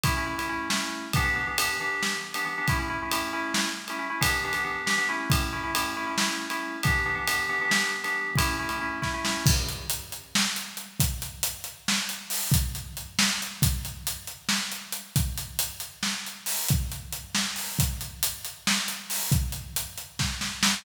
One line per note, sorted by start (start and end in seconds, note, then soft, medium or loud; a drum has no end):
0.04 0.13 A3 loud
0.04 0.13 C#4 medium
0.04 0.13 E4 loud
0.04 kick loud
0.04 ride loud
0.17 0.26 A3 medium
0.17 0.26 C#4 medium
0.17 0.26 E4 medium
0.26 0.35 A3 medium
0.26 0.35 C#4 medium
0.26 0.35 E4 medium
0.38 0.47 A3 medium
0.38 0.47 C#4 medium
0.38 0.47 E4 medium
0.38 ride medium
0.49 0.67 A3 medium
0.49 0.67 C#4 medium
0.49 0.67 E4 loud
0.70 1.05 A3 medium
0.70 1.05 C#4 medium
0.70 1.05 E4 medium
0.70 snare loud
1.13 1.24 E3 loud
1.13 1.24 B3 loud
1.13 1.24 D4 loud
1.13 1.24 G4 medium
1.13 kick loud
1.13 ride loud
1.25 1.33 E3 medium
1.25 1.33 B3 medium
1.25 1.33 D4 medium
1.25 1.33 G4 medium
1.36 1.45 E3 medium
1.36 1.45 B3 medium
1.36 1.45 D4 medium
1.36 1.45 G4 medium
1.47 1.56 E3 medium
1.47 1.56 B3 medium
1.47 1.56 D4 medium
1.47 1.56 G4 medium
1.58 1.75 E3 loud
1.58 1.75 B3 medium
1.58 1.75 D4 medium
1.58 1.75 G4 medium
1.58 ride loud
1.81 2.16 E3 loud
1.81 2.16 B3 medium
1.81 2.16 D4 medium
1.81 2.16 G4 medium
2.03 snare loud
2.34 2.44 E3 medium
2.34 2.44 B3 medium
2.34 2.44 D4 medium
2.34 2.44 G4 medium
2.34 ride medium
2.45 2.54 E3 medium
2.45 2.54 B3 medium
2.45 2.54 D4 medium
2.45 2.54 G4 medium
2.58 2.67 E3 medium
2.58 2.67 B3 medium
2.58 2.67 D4 medium
2.58 2.67 G4 medium
2.68 2.78 A3 loud
2.68 2.78 C#4 loud
2.68 2.78 E4 loud
2.68 kick loud
2.68 ride medium
2.79 2.88 A3 medium
2.79 2.88 C#4 medium
2.79 2.88 E4 medium
2.90 2.99 A3 medium
2.90 2.99 C#4 medium
2.90 2.99 E4 medium
3.02 3.11 A3 medium
3.02 3.11 C#4 medium
3.02 3.11 E4 medium
3.11 3.30 A3 loud
3.11 3.30 C#4 medium
3.11 3.30 E4 medium
3.11 ride loud
3.33 3.68 A3 medium
3.33 3.68 C#4 loud
3.33 3.68 E4 loud
3.54 snare loud
3.88 3.98 A3 medium
3.88 3.98 C#4 medium
3.88 3.98 E4 medium
3.88 ride medium
3.99 4.08 A3 loud
3.99 4.08 C#4 medium
3.99 4.08 E4 medium
4.10 4.19 A3 medium
4.10 4.19 C#4 medium
4.10 4.19 E4 medium
4.21 4.39 E3 loud
4.21 4.39 B3 loud
4.21 4.39 D4 loud
4.21 4.39 G4 loud
4.21 kick loud
4.21 ride loud
4.44 4.53 E3 medium
4.44 4.53 B3 medium
4.44 4.53 D4 loud
4.44 4.53 G4 medium
4.53 4.63 E3 medium
4.53 4.63 B3 medium
4.53 4.63 D4 medium
4.53 4.63 G4 medium
4.53 ride medium
4.64 4.82 E3 medium
4.64 4.82 B3 medium
4.64 4.82 D4 medium
4.64 4.82 G4 medium
4.86 4.95 E3 medium
4.86 4.95 B3 medium
4.86 4.95 D4 medium
4.86 4.95 G4 loud
4.86 snare loud
4.98 5.06 E3 medium
4.98 5.06 B3 medium
4.98 5.06 D4 medium
4.98 5.06 G4 medium
5.09 5.48 A3 medium
5.09 5.48 C#4 loud
5.09 5.48 E4 medium
5.30 kick loud
5.30 ride loud
5.53 5.61 A3 medium
5.53 5.61 C#4 medium
5.53 5.61 E4 medium
5.64 5.72 A3 medium
5.64 5.72 C#4 medium
5.64 5.72 E4 medium
5.75 5.93 A3 medium
5.75 5.93 C#4 medium
5.75 5.93 E4 medium
5.75 ride loud
5.97 6.06 A3 medium
5.97 6.06 C#4 medium
5.97 6.06 E4 medium
6.07 6.15 A3 medium
6.07 6.15 C#4 medium
6.07 6.15 E4 medium
6.18 6.45 A3 medium
6.18 6.45 C#4 medium
6.18 6.45 E4 medium
6.18 snare loud
6.50 6.76 A3 medium
6.50 6.76 C#4 medium
6.50 6.76 E4 medium
6.50 ride medium
6.83 7.01 E3 loud
6.83 7.01 B3 medium
6.83 7.01 D4 loud
6.83 7.01 G4 loud
6.83 kick loud
6.83 ride loud
7.06 7.15 E3 medium
7.06 7.15 B3 medium
7.06 7.15 D4 medium
7.06 7.15 G4 medium
7.15 7.24 E3 medium
7.15 7.24 B3 medium
7.15 7.24 D4 medium
7.15 7.24 G4 medium
7.27 7.45 E3 medium
7.27 7.45 B3 medium
7.27 7.45 D4 medium
7.27 7.45 G4 medium
7.27 ride loud
7.49 7.58 E3 loud
7.49 7.58 B3 medium
7.49 7.58 D4 medium
7.49 7.58 G4 medium
7.61 7.69 E3 medium
7.61 7.69 B3 medium
7.61 7.69 D4 medium
7.61 7.69 G4 medium
7.69 7.96 E3 medium
7.69 7.96 B3 medium
7.69 7.96 D4 medium
7.69 7.96 G4 medium
7.69 snare loud
8.04 8.30 E3 medium
8.04 8.30 B3 medium
8.04 8.30 D4 medium
8.04 8.30 G4 medium
8.04 ride medium
8.35 8.55 A3 loud
8.35 8.55 C#4 loud
8.35 8.55 E4 loud
8.35 kick loud
8.35 ride loud
8.59 8.68 A3 medium
8.59 8.68 C#4 medium
8.59 8.68 E4 medium
8.69 8.78 A3 medium
8.69 8.78 C#4 loud
8.69 8.78 E4 medium
8.69 ride medium
8.81 8.99 A3 medium
8.81 8.99 C#4 medium
8.81 8.99 E4 medium
9.02 9.11 A3 medium
9.02 9.11 C#4 medium
9.02 9.11 E4 medium
9.02 kick medium
9.02 snare medium
9.14 9.23 A3 medium
9.14 9.23 C#4 medium
9.14 9.23 E4 medium
9.25 9.43 A3 medium
9.25 9.43 C#4 medium
9.25 9.43 E4 medium
9.25 snare loud
9.46 kick loud
9.46 crash loud
9.69 closed hi-hat medium
9.90 closed hi-hat loud
10.12 closed hi-hat medium
10.35 snare loud
10.56 closed hi-hat medium
10.77 closed hi-hat medium
11.00 kick loud
11.00 closed hi-hat loud
11.22 closed hi-hat medium
11.43 closed hi-hat loud
11.64 closed hi-hat medium
11.88 snare loud
12.09 closed hi-hat medium
12.30 open hi-hat loud
12.52 kick loud
12.52 closed hi-hat loud
12.75 closed hi-hat medium
12.97 closed hi-hat medium
13.19 snare loud
13.42 closed hi-hat medium
13.62 kick loud
13.62 closed hi-hat loud
13.85 closed hi-hat medium
14.07 closed hi-hat loud
14.27 closed hi-hat medium
14.49 snare loud
14.72 closed hi-hat medium
14.92 closed hi-hat loud
15.16 kick loud
15.16 closed hi-hat loud
15.38 closed hi-hat loud
15.59 closed hi-hat loud
15.80 closed hi-hat medium
16.03 snare loud
16.27 closed hi-hat medium
16.46 open hi-hat loud
16.69 kick loud
16.69 closed hi-hat loud
16.92 closed hi-hat medium
17.13 closed hi-hat loud
17.35 snare loud
17.56 open hi-hat medium
17.79 kick loud
17.79 closed hi-hat loud
18.01 closed hi-hat medium
18.23 closed hi-hat loud
18.45 closed hi-hat medium
18.67 snare loud
18.88 closed hi-hat loud
19.10 open hi-hat loud
19.32 kick loud
19.32 closed hi-hat loud
19.52 closed hi-hat medium
19.76 closed hi-hat loud
19.98 closed hi-hat medium
20.19 kick loud
20.19 snare loud
20.41 snare loud
20.63 snare loud